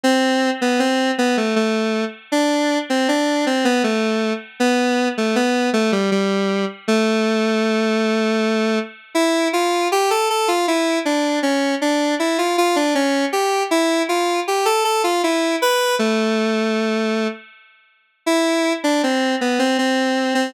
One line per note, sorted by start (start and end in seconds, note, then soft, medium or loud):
0.03 0.50 C4 loud
0.61 0.79 B3 loud
0.79 1.11 C4 loud
1.18 1.36 B3 loud
1.37 1.55 A3 medium
1.56 2.05 A3 medium
2.32 2.78 D4 loud
2.90 3.08 C4 medium
3.08 3.45 D4 medium
3.46 3.64 C4 medium
3.65 3.83 B3 loud
3.84 4.33 A3 medium
4.60 5.08 B3 loud
5.17 5.35 A3 medium
5.35 5.70 B3 loud
5.73 5.91 A3 loud
5.92 6.10 G3 loud
6.11 6.65 G3 medium
6.88 8.79 A3 loud
9.15 9.48 E4 loud
9.53 9.88 F4 medium
9.92 10.10 G4 loud
10.10 10.28 A4 loud
10.30 10.48 A4 medium
10.48 10.66 F4 medium
10.68 10.99 E4 medium
11.05 11.39 D4 medium
11.43 11.75 C#4 medium
11.81 12.15 D4 medium
12.19 12.37 E4 medium
12.38 12.56 F4 medium
12.58 12.76 F4 loud
12.76 12.94 D4 loud
12.95 13.25 C#4 loud
13.32 13.63 G4 medium
13.71 14.02 E4 loud
14.09 14.40 F4 medium
14.47 14.66 G4 medium
14.65 14.83 A4 loud
14.84 15.02 A4 loud
15.04 15.22 F4 medium
15.23 15.56 E4 medium
15.62 15.95 B4 loud
15.99 17.28 A3 loud
18.26 18.73 E4 loud
18.84 19.02 D4 loud
19.03 19.35 C4 medium
19.41 19.59 B3 medium
19.59 19.77 C4 loud
19.78 20.34 C4 medium
20.34 20.53 C4 loud